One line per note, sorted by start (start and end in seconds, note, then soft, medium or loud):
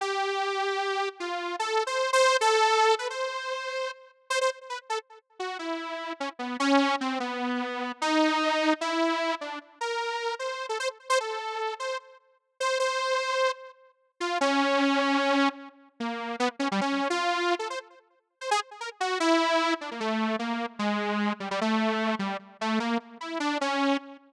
0.01 1.09 G4 medium
1.20 1.56 F4 medium
1.59 1.83 A4 medium
1.87 2.11 C5 medium
2.13 2.37 C5 loud
2.41 2.95 A4 loud
2.99 3.08 B4 medium
3.10 3.91 C5 medium
4.30 4.39 C5 loud
4.41 4.50 C5 medium
4.70 4.79 B4 soft
4.90 4.99 A4 medium
5.40 5.58 F#4 medium
5.59 6.13 E4 medium
6.20 6.29 C#4 medium
6.39 6.57 B3 medium
6.60 6.96 C#4 loud
7.01 7.19 C4 medium
7.20 7.92 B3 medium
8.02 8.74 D#4 loud
8.81 9.35 E4 medium
9.41 9.59 D4 medium
9.81 10.35 A#4 medium
10.39 10.66 C5 medium
10.69 10.78 A4 medium
10.80 10.89 C5 medium
11.10 11.19 C5 loud
11.20 11.74 A4 medium
11.80 11.98 C5 medium
12.60 12.78 C5 medium
12.80 13.52 C5 medium
14.20 14.38 F4 medium
14.41 15.49 C#4 loud
16.00 16.36 A#3 medium
16.40 16.49 B3 loud
16.59 16.68 C#4 medium
16.71 16.80 G3 loud
16.81 17.08 C#4 medium
17.10 17.55 F4 medium
17.59 17.68 A4 medium
17.70 17.79 C5 medium
18.41 18.50 C5 soft
18.51 18.60 G#4 loud
18.81 18.90 A#4 medium
19.00 19.18 F#4 medium
19.20 19.74 E4 loud
19.81 19.90 D4 medium
19.91 20.00 A#3 soft
20.00 20.36 A3 medium
20.39 20.66 A#3 medium
20.79 21.33 G#3 medium
21.40 21.49 G3 medium
21.51 21.60 G3 medium
21.61 22.15 A3 medium
22.19 22.37 G3 medium
22.61 22.79 A3 medium
22.80 22.98 A#3 medium
23.21 23.39 E4 medium
23.40 23.58 D4 medium
23.61 23.97 C#4 medium